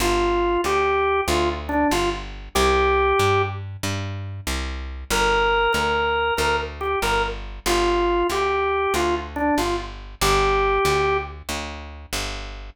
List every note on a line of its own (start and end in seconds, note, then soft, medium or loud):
0.00 0.58 G1 loud
0.00 0.61 F4 loud
0.64 1.22 D2 medium
0.64 1.21 G4 loud
1.28 1.85 D2 loud
1.28 1.49 F4 medium
1.69 1.88 D4 loud
1.91 2.49 G1 medium
1.91 2.10 F4 medium
2.55 3.13 C2 loud
2.55 3.42 G4 loud
3.19 3.77 G2 medium
3.83 4.41 G2 medium
4.47 5.04 C2 medium
5.10 5.68 G1 loud
5.10 5.72 A#4 loud
5.73 6.32 D2 medium
5.73 6.34 A#4 medium
6.37 6.96 D2 medium
6.37 6.56 A#4 medium
6.81 6.99 G4 medium
7.02 7.60 G1 medium
7.02 7.23 A#4 medium
7.66 8.23 G1 loud
7.66 8.27 F4 loud
8.30 8.87 D2 medium
8.30 8.93 G4 medium
8.94 9.51 D2 medium
8.94 9.15 F4 loud
9.36 9.55 D4 loud
9.58 10.15 G1 medium
9.58 9.76 F4 medium
10.21 10.79 G1 loud
10.21 11.17 G4 loud
10.85 11.42 D2 medium
11.49 12.06 D2 medium
12.13 12.70 G1 medium